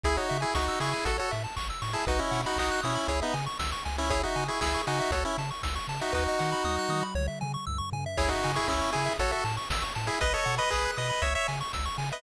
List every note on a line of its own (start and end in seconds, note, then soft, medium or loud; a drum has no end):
0.03 0.18 C#2 loud
0.03 0.17 E4 loud
0.03 0.16 G#4 medium
0.03 0.17 G#4 loud
0.03 kick medium
0.03 closed hi-hat medium
0.17 0.38 D#4 medium
0.17 0.38 F#4 medium
0.17 0.28 C#5 medium
0.29 0.45 C#3 medium
0.29 0.41 E5 medium
0.29 open hi-hat medium
0.41 0.54 E4 medium
0.41 0.54 G#4 loud
0.41 0.52 G#5 medium
0.54 0.69 C#2 medium
0.54 0.79 D#4 medium
0.54 0.79 F#4 medium
0.54 0.66 C#6 medium
0.54 kick medium
0.54 snare medium
0.68 0.80 E6 medium
0.80 0.94 C#3 medium
0.80 1.05 E4 medium
0.80 1.05 G#4 medium
0.80 0.93 C#6 medium
0.80 open hi-hat medium
0.93 1.04 G#5 medium
1.05 1.19 A1 medium
1.05 1.17 F#4 medium
1.05 1.17 A4 medium
1.05 1.18 A4 medium
1.05 kick medium
1.05 closed hi-hat loud
1.18 1.31 F#4 medium
1.18 1.31 A4 medium
1.18 1.29 C#5 medium
1.31 1.47 A2 medium
1.31 1.43 E5 medium
1.31 open hi-hat medium
1.44 1.55 A5 medium
1.56 1.71 A1 medium
1.56 1.68 C#6 medium
1.56 kick medium
1.56 clap medium
1.70 1.81 E6 medium
1.82 1.96 A2 medium
1.82 1.93 C#6 medium
1.82 open hi-hat medium
1.93 2.05 E4 medium
1.93 2.05 G#4 medium
1.93 2.05 A5 medium
2.07 2.21 B1 loud
2.07 2.20 D#4 medium
2.07 2.20 F#4 loud
2.07 2.19 B4 medium
2.07 kick medium
2.07 closed hi-hat medium
2.19 2.41 C#4 medium
2.19 2.41 E4 medium
2.19 2.31 D#5 medium
2.31 2.45 B2 medium
2.31 2.42 F#5 medium
2.31 open hi-hat medium
2.46 2.58 D#4 medium
2.46 2.58 F#4 medium
2.46 2.57 B5 medium
2.56 2.70 B1 medium
2.56 2.81 D#4 medium
2.56 2.81 F#4 loud
2.56 2.70 D#6 medium
2.56 kick medium
2.56 clap loud
2.72 2.83 F#6 medium
2.83 2.98 B2 medium
2.83 3.08 C#4 medium
2.83 3.08 E4 medium
2.83 2.95 D#6 medium
2.83 open hi-hat medium
2.95 3.07 B5 medium
3.08 3.22 C#2 loud
3.08 3.20 E4 medium
3.08 3.20 G#4 medium
3.08 3.20 C#5 loud
3.08 kick medium
3.08 closed hi-hat medium
3.22 3.35 B3 medium
3.22 3.35 D#4 loud
3.22 3.33 E5 medium
3.34 3.48 C#3 medium
3.34 3.45 G#5 medium
3.34 open hi-hat medium
3.46 3.58 C#6 medium
3.59 3.74 C#2 medium
3.59 3.71 E6 medium
3.59 kick medium
3.59 snare loud
3.72 3.84 C#6 medium
3.85 4.25 C#2 medium
3.85 3.97 G#5 medium
3.85 open hi-hat medium
3.98 4.10 C#4 medium
3.98 4.10 E4 loud
3.98 4.10 E5 medium
4.10 4.22 E4 loud
4.10 4.22 G#4 loud
4.10 4.22 C#5 loud
4.10 kick loud
4.10 closed hi-hat medium
4.23 4.44 D#4 medium
4.23 4.44 F#4 medium
4.23 4.36 E5 medium
4.36 4.50 C#3 medium
4.36 4.47 G#5 medium
4.36 open hi-hat medium
4.48 4.60 E4 medium
4.48 4.60 G#4 medium
4.48 4.62 C#6 medium
4.61 4.76 C#2 medium
4.61 4.82 E4 medium
4.61 4.82 G#4 loud
4.61 4.73 E6 medium
4.61 kick medium
4.61 snare loud
4.74 4.86 C#6 medium
4.87 5.01 C#3 medium
4.87 5.11 D#4 medium
4.87 5.11 F#4 loud
4.87 4.99 G#5 medium
4.87 open hi-hat medium
5.00 5.11 E5 medium
5.11 5.25 C#2 loud
5.11 5.24 F#4 medium
5.11 5.24 A4 medium
5.11 5.23 C#5 medium
5.11 kick medium
5.11 closed hi-hat medium
5.25 5.37 C#4 medium
5.25 5.37 E4 medium
5.25 5.37 E5 medium
5.38 5.52 C#3 medium
5.38 5.50 A5 medium
5.38 open hi-hat medium
5.51 5.62 C#6 medium
5.63 5.79 C#2 medium
5.63 5.75 E6 medium
5.63 kick medium
5.63 snare loud
5.75 5.87 C#6 medium
5.88 6.01 C#3 medium
5.88 6.00 A5 medium
5.88 open hi-hat medium
6.01 6.13 D#4 medium
6.01 6.13 F#4 medium
6.01 6.13 E5 medium
6.12 6.27 D#2 loud
6.12 7.03 D#4 medium
6.12 7.03 F#4 medium
6.12 6.24 B4 loud
6.12 kick medium
6.12 snare medium
6.28 6.40 D#5 medium
6.39 6.54 D#3 medium
6.39 6.50 F#5 medium
6.39 snare medium
6.52 6.63 B5 medium
6.64 6.78 D#2 medium
6.64 6.76 D#6 medium
6.64 high tom medium
6.79 6.90 F#6 medium
6.89 7.03 D#3 medium
6.89 7.01 D#6 medium
6.89 high tom medium
7.03 7.14 B5 medium
7.15 7.29 C#2 loud
7.15 7.27 C#5 loud
7.15 mid tom medium
7.28 7.39 E5 medium
7.41 7.57 C#3 medium
7.41 7.52 G#5 medium
7.41 mid tom medium
7.54 7.65 C#6 medium
7.67 7.81 C#2 medium
7.67 7.78 E6 medium
7.67 floor tom medium
7.78 7.90 C#6 medium
7.92 8.06 C#3 medium
7.92 8.04 G#5 medium
7.92 floor tom medium
8.06 8.17 E5 medium
8.17 8.33 C#2 loud
8.17 8.30 E4 loud
8.17 8.30 G#4 loud
8.17 8.29 C#5 loud
8.17 kick medium
8.17 crash medium
8.29 8.52 D#4 medium
8.29 8.52 F#4 loud
8.29 8.42 E5 medium
8.43 8.59 C#3 medium
8.43 8.56 G#5 medium
8.43 open hi-hat medium
8.55 8.67 E4 loud
8.55 8.68 G#4 loud
8.55 8.67 C#6 medium
8.68 8.82 C#2 medium
8.68 8.91 C#4 medium
8.68 8.91 E4 loud
8.68 8.81 E6 medium
8.68 kick medium
8.68 clap medium
8.82 8.93 C#6 medium
8.92 9.09 C#3 medium
8.92 9.13 E4 medium
8.92 9.13 G#4 loud
8.92 9.05 G#5 medium
8.92 open hi-hat medium
9.06 9.17 E5 medium
9.19 9.33 A1 loud
9.19 9.31 F#4 medium
9.19 9.31 A4 loud
9.19 9.32 C#5 loud
9.19 kick medium
9.19 closed hi-hat medium
9.31 9.44 F#4 medium
9.31 9.44 A4 loud
9.31 9.43 E5 medium
9.44 9.58 A2 medium
9.44 9.56 A5 medium
9.44 open hi-hat medium
9.57 9.69 C#6 medium
9.70 9.84 A1 medium
9.70 9.83 E6 medium
9.70 kick medium
9.70 snare loud
9.82 9.93 C#6 medium
9.95 10.10 A2 medium
9.95 10.07 A5 medium
9.95 open hi-hat medium
10.07 10.19 E4 medium
10.07 10.19 G#4 loud
10.07 10.20 E5 medium
10.20 10.36 B1 medium
10.20 10.33 B4 loud
10.20 10.33 D#5 loud
10.20 kick medium
10.20 closed hi-hat medium
10.33 10.55 A4 loud
10.33 10.55 C#5 loud
10.33 10.45 D#5 medium
10.45 10.60 B2 medium
10.45 10.57 F#5 medium
10.45 open hi-hat medium
10.58 10.70 B4 loud
10.58 10.71 D#5 loud
10.58 10.69 B5 medium
10.70 10.88 B1 medium
10.70 10.91 G#4 loud
10.70 10.91 B4 loud
10.70 10.85 D#6 medium
10.70 kick medium
10.70 clap medium
10.85 10.97 F#6 medium
10.97 11.12 B2 medium
10.97 11.23 B4 medium
10.97 11.23 D#5 medium
10.97 11.08 D#6 medium
10.97 open hi-hat medium
11.10 11.21 B5 medium
11.22 11.36 C#2 loud
11.22 11.34 C#5 medium
11.22 11.34 C#5 loud
11.22 11.34 E5 medium
11.22 kick medium
11.22 closed hi-hat medium
11.35 11.47 C#5 loud
11.35 11.47 E5 loud
11.35 11.47 E5 medium
11.48 11.62 C#3 medium
11.48 11.59 G#5 medium
11.48 open hi-hat medium
11.61 11.72 C#6 medium
11.73 11.89 C#2 medium
11.73 11.85 E6 medium
11.73 kick medium
11.73 snare medium
11.85 11.97 C#6 medium
11.98 12.12 C#3 medium
11.98 12.09 G#5 medium
11.98 open hi-hat medium
12.12 12.22 B4 loud
12.12 12.22 D#5 loud
12.12 12.22 E5 medium